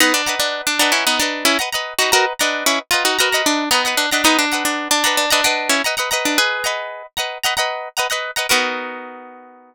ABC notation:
X:1
M:4/4
L:1/16
Q:1/4=113
K:Bmix
V:1 name="Acoustic Guitar (steel)"
[B,D] =D2 D2 D D [CE] [B,^D] =D2 [CE] z3 [^DF] | [F^A] z =D2 [CE] z ^E [^DF] [FA]2 =D2 [B,^D]2 =D D | [B,D] =D2 D2 D D D D D2 [CE] z3 D | [GB]6 z10 |
B16 |]
V:2 name="Acoustic Guitar (steel)"
[Bdf^a]2 [Bdfa]4 [Bdfa]3 [Bdfa]3 [Bdfa] [Bdfa]2 [Bdfa] | [Bdf^a]2 [Bdfa]4 [Bdfa]2 [Bdfa] [Bdfa]3 [Bdfa] [Bdfa]2 [Bdfa] | [Bdf^a]2 [Bdfa]4 [Bdfa]2 [Bdfa] [Bdfa]3 [Bdfa] [Bdfa] [Bdfa]2- | [Bdf^a]2 [Bdfa]4 [Bdfa]2 [Bdfa] [Bdfa]3 [Bdfa] [Bdfa]2 [Bdfa] |
[B,DF^A]16 |]